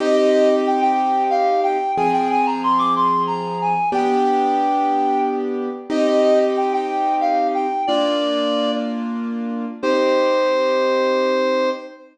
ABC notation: X:1
M:6/8
L:1/16
Q:3/8=61
K:Cm
V:1 name="Clarinet"
e e e z g g3 f2 g2 | a g a b c' d' c'2 b2 a2 | g8 z4 | e e e z g g3 f2 g2 |
d6 z6 | c12 |]
V:2 name="Acoustic Grand Piano"
[CEG]12 | [F,CA]12 | [=B,DG]12 | [CEG]12 |
[B,DF]12 | [CEG]12 |]